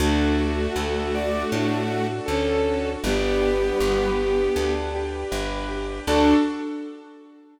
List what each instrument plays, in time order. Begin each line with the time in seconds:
0.00 electric bass (finger) D2, violin A3 F#4, string ensemble 1 D4 F#4 A4, acoustic grand piano D4
0.38 acoustic grand piano F#4
0.75 electric bass (finger) D2, acoustic grand piano A4
1.14 acoustic grand piano F#4, ocarina D5
1.51 electric bass (finger) A2, acoustic grand piano D4, ocarina F#4
1.90 acoustic grand piano F#4
2.26 electric bass (finger) D2, violin C#4 A4, acoustic grand piano A4
2.65 acoustic grand piano F#4
3.04 electric bass (finger) G1, ocarina G3 B3, violin B3 G4, acoustic grand piano D4, string ensemble 1 D4 G4 B4
3.42 acoustic grand piano G4
3.78 electric bass (finger) G1, acoustic grand piano B4
4.18 acoustic grand piano G4
4.56 electric bass (finger) D2, acoustic grand piano D4
4.94 acoustic grand piano G4
5.31 electric bass (finger) G1, acoustic grand piano B4
5.69 acoustic grand piano G4
6.07 electric bass (finger) D2, ocarina D4, acoustic grand piano D4 F#4 A4, string ensemble 1 D4 F#4 A4, violin D4